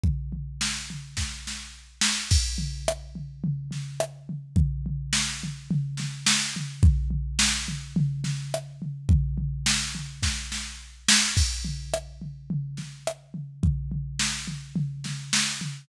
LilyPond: \new DrumStaff \drummode { \time 4/4 \tempo 4 = 106 <bd tomfh>8 tomfh8 sn8 tomfh8 <bd sn>8 sn8 r8 sn8 | <cymc bd>8 tomfh8 ss8 tomfh8 tomfh8 <sn tomfh>8 ss8 tomfh8 | <bd tomfh>8 tomfh8 sn8 tomfh8 tomfh8 <sn tomfh>8 sn8 tomfh8 | <bd tomfh>8 tomfh8 sn8 tomfh8 tomfh8 <sn tomfh>8 ss8 tomfh8 |
<bd tomfh>8 tomfh8 sn8 tomfh8 <bd sn>8 sn8 r8 sn8 | <cymc bd>8 tomfh8 ss8 tomfh8 tomfh8 <sn tomfh>8 ss8 tomfh8 | <bd tomfh>8 tomfh8 sn8 tomfh8 tomfh8 <sn tomfh>8 sn8 tomfh8 | }